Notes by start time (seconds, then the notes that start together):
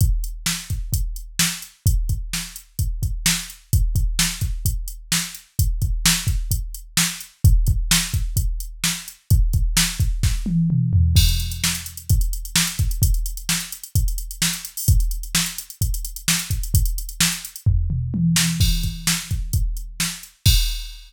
0.01 kick, closed hi-hat
0.24 closed hi-hat
0.46 snare
0.70 kick, closed hi-hat
0.93 kick, closed hi-hat
1.16 closed hi-hat
1.39 snare
1.62 closed hi-hat
1.86 kick, closed hi-hat
2.09 kick, closed hi-hat
2.33 snare
2.56 closed hi-hat
2.79 kick, closed hi-hat
3.03 kick, closed hi-hat
3.26 snare
3.50 closed hi-hat
3.73 kick, closed hi-hat
3.95 kick, closed hi-hat
4.19 snare
4.41 kick, closed hi-hat
4.65 kick, closed hi-hat
4.88 closed hi-hat
5.12 snare
5.35 closed hi-hat
5.59 kick, closed hi-hat
5.82 kick, closed hi-hat
6.06 snare
6.27 kick, closed hi-hat
6.51 kick, closed hi-hat
6.75 closed hi-hat
6.97 snare
7.21 closed hi-hat
7.44 kick, closed hi-hat
7.67 kick, closed hi-hat
7.91 snare
8.14 kick, closed hi-hat
8.37 kick, closed hi-hat
8.60 closed hi-hat
8.84 snare
9.08 closed hi-hat
9.30 kick, closed hi-hat
9.53 kick, closed hi-hat
9.77 snare
10.00 kick, closed hi-hat
10.23 kick, snare
10.46 high tom
10.70 mid tom
10.93 floor tom
11.16 kick, crash
11.29 closed hi-hat
11.40 closed hi-hat
11.52 closed hi-hat
11.64 snare
11.75 closed hi-hat
11.86 closed hi-hat
11.97 closed hi-hat
12.09 kick, closed hi-hat
12.21 closed hi-hat
12.33 closed hi-hat
12.45 closed hi-hat
12.56 snare
12.67 closed hi-hat
12.79 kick, closed hi-hat
12.91 closed hi-hat
13.02 kick, closed hi-hat
13.14 closed hi-hat
13.26 closed hi-hat
13.37 closed hi-hat
13.49 snare
13.60 closed hi-hat
13.72 closed hi-hat
13.84 closed hi-hat
13.95 kick, closed hi-hat
14.08 closed hi-hat
14.18 closed hi-hat
14.31 closed hi-hat
14.42 snare
14.53 closed hi-hat
14.65 closed hi-hat
14.77 open hi-hat
14.88 kick, closed hi-hat
15.00 closed hi-hat
15.11 closed hi-hat
15.23 closed hi-hat
15.35 snare
15.46 closed hi-hat
15.58 closed hi-hat
15.70 closed hi-hat
15.81 kick, closed hi-hat
15.94 closed hi-hat
16.05 closed hi-hat
16.16 closed hi-hat
16.28 snare
16.39 closed hi-hat
16.50 kick, closed hi-hat
16.63 closed hi-hat
16.74 kick, closed hi-hat
16.85 closed hi-hat
16.98 closed hi-hat
17.09 closed hi-hat
17.20 snare
17.32 closed hi-hat
17.45 closed hi-hat
17.56 closed hi-hat
17.66 kick, floor tom
17.90 mid tom
18.14 high tom
18.36 snare
18.60 kick, crash
18.83 kick, closed hi-hat
19.07 snare
19.31 kick, closed hi-hat
19.53 kick, closed hi-hat
19.77 closed hi-hat
20.00 snare
20.23 closed hi-hat
20.46 kick, crash